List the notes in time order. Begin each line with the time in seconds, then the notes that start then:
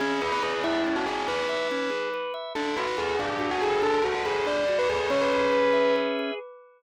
0.00 C#4 G#4
0.21 G#4 B4
0.32 B4
0.43 G#4 B4
0.64 E4 E5
0.87 C#4
0.96 F#4
1.06 G#4
1.28 B4
1.49 E5
1.71 C#4
1.90 G#4
2.14 B4
2.34 E5
2.55 D4 A4
2.77 F#4 B4
2.87 B4
2.97 G#4 A4
3.19 D4
3.39 F#4
3.51 F#4
3.62 G#4 A4
3.82 D4 A4
4.03 F#4
4.15 F#4
4.25 G#4 A4
4.45 D4 D5
4.68 F#4
4.79 B4
4.89 G#4 A4
5.10 C#4 C#5
5.21 B4
5.33 G#4
5.52 B4
5.73 E5
5.96 B4
6.19 G#4